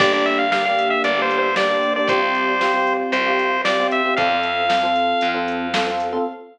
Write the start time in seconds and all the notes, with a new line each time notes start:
0.00 G1 A#3 D4 G4 D5, kick, crash
0.13 A#3 D4 G4 D5
0.26 E5, closed hi-hat
0.39 F5
0.52 A#3 D4 G4 F5, snare
0.65 A#3 D4 G4 F5
0.79 closed hi-hat
0.90 E5
1.04 G1 D5, closed hi-hat
1.18 A#3 D4 G4
1.22 C5
1.31 closed hi-hat
1.38 C5
1.56 A#3 D4 G4 D5, snare
1.70 A#3 D4 G4
1.83 closed hi-hat
1.96 A#3 D4 G4 D5
2.07 C2 C4 F4 G4 C5, kick, closed hi-hat
2.20 C4 F4 G4
2.35 closed hi-hat
2.60 C4 F4 G4, snare
2.74 C4 F4 G4
2.87 closed hi-hat
3.12 C2 C5, closed hi-hat
3.26 C4 F4 G4
3.39 closed hi-hat
3.65 C4 F4 G4 D5, snare
3.80 C4 F4 G4
3.91 E5, closed hi-hat
4.05 C4 F4 G4
4.17 F2 C4 F4 A4 F5, kick, closed hi-hat
4.30 C4 F4 A4
4.43 closed hi-hat
4.69 C4 F4 A4, snare
4.83 C4 F4 A4
4.96 closed hi-hat
5.21 F2, closed hi-hat
5.34 C4 F4 A4
5.48 closed hi-hat
5.74 C4 F4 A4, snare
5.87 C4 F4 A4
6.00 closed hi-hat
6.12 C4 F4 A4